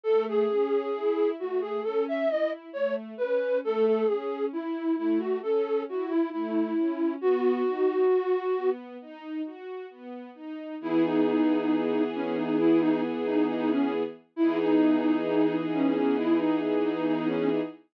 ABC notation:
X:1
M:4/4
L:1/16
Q:1/4=67
K:E
V:1 name="Flute"
A G5 F G A e d z c z B2 | A A G2 E2 E F A2 F E E4 | F8 z8 | E D5 C D E D z D D C z2 |
E D5 C C E D z D D C z2 |]
V:2 name="String Ensemble 1"
A,2 C2 E2 A,2 C2 E2 A,2 C2 | A,2 C2 E2 A,2 C2 E2 A,2 C2 | B,2 D2 F2 B,2 D2 F2 B,2 D2 | [E,B,G]16 |
[E,B,DG]16 |]